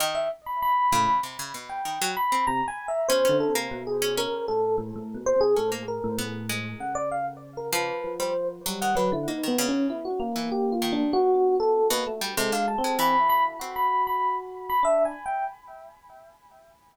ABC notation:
X:1
M:5/4
L:1/16
Q:1/4=97
K:none
V:1 name="Electric Piano 1"
_e =e z b b4 z3 g3 b2 (3_b2 _a2 e2 | c2 A z2 _A2 _B2 =A2 z3 c _A =A z B2 | z4 _g d f z2 _B =B3 c2 z2 g B E | (3_E2 B,2 _D2 =E _G z2 (3=G2 F2 =D2 _G3 A2 B z2 |
A f a2 b2 b z2 b2 b2 z2 b (3e2 _a2 g2 |]
V:2 name="Electric Piano 1"
z6 A,, z9 C, z3 | (3B,,2 D,2 C,2 B,,4 z A,,2 A,, (3A,,2 B,,2 C,2 A,,3 A,, | A,,4 _D,8 F,4 G,2 _G, =D, | z6 _B,6 =B,5 _B, A, z |
(3_A,4 C4 E4 _G8 D2 z2 |]
V:3 name="Harpsichord"
_E,2 z4 _D,2 C, D, B,,2 E, _G, z C z4 | _D D2 _B,2 z D D9 D B, z2 | B,2 _A,4 z4 F,3 G, z2 _G, _E, D, z | _B, _E, _D,3 z2 =E, z2 _E,4 z3 =B,, z G, |
C, D, z _A, E,4 C2 z10 |]